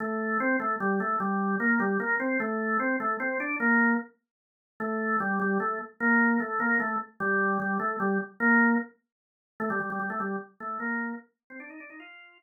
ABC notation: X:1
M:6/8
L:1/16
Q:3/8=100
K:Fmix
V:1 name="Drawbar Organ"
A,4 C2 A,2 G,2 A,2 | G,4 B,2 G,2 B,2 C2 | A,4 C2 A,2 C2 D2 | B,4 z8 |
A,4 G,2 G,2 A,2 z2 | B,4 A,2 B,2 A,2 z2 | G,4 G,2 A,2 G,2 z2 | B,4 z8 |
A, G, G, G, G, A, G,2 z2 A,2 | B,4 z3 C D E D E | F4 z8 |]